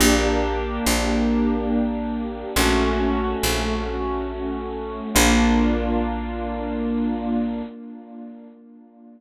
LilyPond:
<<
  \new Staff \with { instrumentName = "Acoustic Grand Piano" } { \time 3/4 \key bes \major \tempo 4 = 70 <bes d' g'>2. | <a des' ges'>2. | <bes d' f'>2. | }
  \new Staff \with { instrumentName = "Electric Bass (finger)" } { \clef bass \time 3/4 \key bes \major bes,,4 bes,,2 | bes,,4 bes,,2 | bes,,2. | }
>>